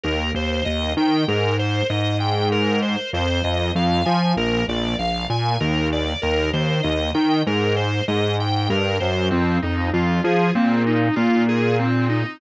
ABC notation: X:1
M:5/4
L:1/8
Q:1/4=97
K:Fdor
V:1 name="Drawbar Organ"
B c e g B c e g B c | c e f a B d f a B d | B c e g B c e g B c | C E F A C E F A C E |]
V:2 name="Synth Bass 1" clef=bass
E,, E,, E,, E, A,,2 A,,4 | F,, F,, F,, F, B,,, B,,, B,,, B,, E,,2 | E,, E,, E,, E, A,,2 A,,2 G,, _G,, | F,, F,, F,, F, B,,2 B,,4 |]